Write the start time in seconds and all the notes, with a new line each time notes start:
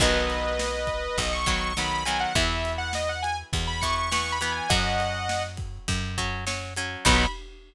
0.00 B1 D#3 F#3 B3 B4 D#5, kick, crash
0.30 ride
0.59 snare
0.87 kick, ride
1.18 B1 D#5, kick, ride
1.33 C#6
1.46 D#3 F#3 B3, kick, ride
1.77 D#3 F#3 B3 B5, snare
2.05 D#3 F#3 B3 G#5, ride
2.20 F#5
2.35 E2 E3 B3 E5, kick, ride
2.65 ride
2.78 F#5
2.93 D#5, snare
3.09 F#5
3.22 G#5, ride
3.53 E2, kick, ride
3.67 B5
3.81 E3 B3 C#6, kick, ride
3.98 C#6
4.12 E3 B3 C#6, snare
4.32 B5
4.41 E3 B3, ride
4.52 G#5
4.69 F#2 F#3 C#4 D#5 F#5, kick, ride
5.00 ride
5.29 snare
5.57 kick, ride
5.88 F#2, kick, ride
6.18 F#3 C#4, kick, ride
6.47 F#3 C#4, snare
6.76 F#3 C#4, ride
7.05 B1 D#3 F#3 B3 B5, kick, crash